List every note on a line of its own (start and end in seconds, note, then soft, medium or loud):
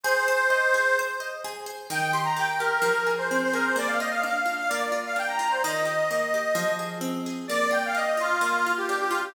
0.03 0.25 G#4 loud
0.03 0.97 C5 loud
0.28 0.49 C5 medium
0.50 0.71 D#5 medium
0.74 0.95 G#4 medium
0.99 1.20 C5 medium
1.20 1.41 D#5 medium
1.44 1.65 G#4 medium
1.66 1.87 C5 medium
1.90 2.78 D#3 medium
1.90 2.11 G5 loud
2.12 2.60 G4 medium
2.12 2.24 C6 loud
2.24 2.35 A#5 loud
2.36 2.81 A#3 medium
2.36 2.49 G5 loud
2.50 2.61 G5 medium
2.59 2.82 G4 medium
2.59 3.10 A#4 loud
2.82 3.70 F3 medium
3.06 3.53 G#4 medium
3.18 3.29 C5 medium
3.30 3.75 C4 medium
3.30 3.41 C5 loud
3.44 3.55 C5 loud
3.53 3.75 G#4 medium
3.53 3.64 A#4 loud
3.65 3.76 C5 medium
3.76 4.64 A#3 medium
3.76 3.88 D5 loud
3.87 3.98 F5 medium
3.99 4.45 F4 medium
3.99 4.10 D#5 loud
4.11 4.22 F5 loud
4.23 4.68 D4 medium
4.23 4.56 F5 medium
4.46 4.68 F4 medium
4.58 4.69 F5 loud
4.68 5.59 A#3 medium
4.68 4.98 D5 medium
4.92 5.38 F4 medium
5.05 5.16 F5 loud
5.16 5.60 D4 medium
5.16 5.29 G5 loud
5.28 5.37 A#5 loud
5.38 5.61 F4 medium
5.38 5.49 A#5 loud
5.51 5.62 C5 medium
5.63 6.52 D#3 medium
5.63 6.71 D#5 loud
5.85 6.33 G4 medium
6.11 6.55 A#3 medium
6.34 6.56 G4 medium
6.55 7.43 F3 medium
6.79 7.26 G#4 medium
7.01 7.45 C4 medium
7.26 7.48 G#4 medium
7.48 8.38 A#3 medium
7.48 7.70 D5 loud
7.71 8.17 F4 medium
7.71 7.83 G5 loud
7.85 7.96 F5 loud
7.94 8.39 D4 medium
7.94 8.06 D#5 loud
8.06 8.18 D#5 medium
8.17 8.39 F4 medium
8.17 8.72 F4 loud
8.41 9.29 A#3 medium
8.66 9.10 F4 medium
8.77 8.87 G4 medium
8.88 9.33 D4 medium
8.88 8.99 G4 loud
9.00 9.11 G4 loud
9.10 9.21 F4 loud
9.10 9.33 F4 medium
9.24 9.34 G4 loud